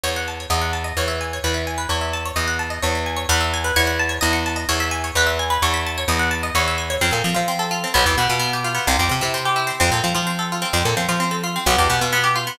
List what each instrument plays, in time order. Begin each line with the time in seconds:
0.03 electric bass (finger) E2, harpsichord C#5
0.16 harpsichord F#5
0.28 harpsichord A5
0.40 harpsichord C#5
0.50 electric bass (finger) E2, harpsichord D#5
0.61 harpsichord F#5
0.73 harpsichord A5
0.84 harpsichord D#5
0.97 electric bass (finger) E2, harpsichord C#5
1.08 harpsichord E5
1.21 harpsichord G#5
1.33 harpsichord C#5
1.44 electric bass (finger) E2, harpsichord B4
1.54 harpsichord E5
1.67 harpsichord G#5
1.78 harpsichord B4
1.89 electric bass (finger) E2, harpsichord C#5
2.01 harpsichord E5
2.13 harpsichord A5
2.25 harpsichord C#5
2.36 electric bass (finger) E2, harpsichord D#5
2.48 harpsichord F#5
2.59 harpsichord A5
2.70 harpsichord D#5
2.82 electric bass (finger) E2, harpsichord C#5
2.95 harpsichord E5
3.06 harpsichord G#5
3.17 harpsichord C#5
3.29 electric bass (finger) E2, harpsichord B4
3.41 harpsichord E5
3.54 harpsichord G#5
3.64 harpsichord B4
3.76 electric bass (finger) E2, harpsichord C#5
3.87 harpsichord F#5
3.99 harpsichord A5
4.09 harpsichord C#5
4.21 electric bass (finger) E2, harpsichord D#5
4.33 harpsichord F#5
4.46 harpsichord A5
4.56 harpsichord D#5
4.69 electric bass (finger) E2, harpsichord C#5
4.80 harpsichord E5
4.91 harpsichord G#5
5.04 harpsichord C#5
5.15 electric bass (finger) E2, harpsichord B4
5.27 harpsichord E5
5.39 harpsichord G#5
5.50 harpsichord B4
5.62 electric bass (finger) E2, harpsichord C#5
5.74 harpsichord E5
5.86 harpsichord A5
5.98 harpsichord C#5
6.08 electric bass (finger) E2, harpsichord D#5
6.19 harpsichord F#5
6.31 harpsichord A5
6.43 harpsichord D#5
6.55 electric bass (finger) E2, harpsichord C#5
6.68 harpsichord E5
6.78 harpsichord G#5
6.90 harpsichord C#5
7.01 electric bass (finger) F2, harpsichord C4
7.11 electric bass (finger) A#2, harpsichord A4
7.24 electric bass (finger) F3, harpsichord C4
7.34 electric bass (finger) F3, harpsichord F4
7.48 harpsichord C4
7.59 harpsichord A4
7.71 harpsichord F4
7.84 harpsichord C4
7.94 electric bass (finger) B1, harpsichord B3
8.06 electric bass (finger) E2, harpsichord G4
8.18 electric bass (finger) B2, harpsichord B3
8.29 electric bass (finger) B2, harpsichord F4
8.39 harpsichord B3
8.53 harpsichord G4
8.64 harpsichord F4
8.75 harpsichord B3
8.87 electric bass (finger) C2, harpsichord C4
8.99 electric bass (finger) F2, harpsichord G4
9.09 electric bass (finger) C3, harpsichord C4
9.21 electric bass (finger) C3, harpsichord E4
9.34 harpsichord C4
9.45 harpsichord G4
9.56 harpsichord E4
9.67 harpsichord C4
9.80 electric bass (finger) F2, harpsichord C4
9.92 electric bass (finger) A#2, harpsichord A4
10.04 electric bass (finger) F3, harpsichord C4
10.15 electric bass (finger) F3, harpsichord F4
10.27 harpsichord C4
10.39 harpsichord A4
10.52 harpsichord F4
10.62 harpsichord C4
10.73 electric bass (finger) F2, harpsichord C4
10.85 electric bass (finger) A#2, harpsichord A4
10.97 electric bass (finger) F3, harpsichord C4
11.09 electric bass (finger) F3, harpsichord F4
11.20 harpsichord C4
11.31 harpsichord A4
11.44 harpsichord F4
11.56 harpsichord C4
11.66 electric bass (finger) B1, harpsichord B3
11.78 electric bass (finger) E2, harpsichord G4
11.90 electric bass (finger) B2, harpsichord B3
12.01 electric bass (finger) B2, harpsichord F4
12.13 harpsichord B3
12.24 harpsichord G4
12.36 harpsichord F4
12.47 harpsichord B3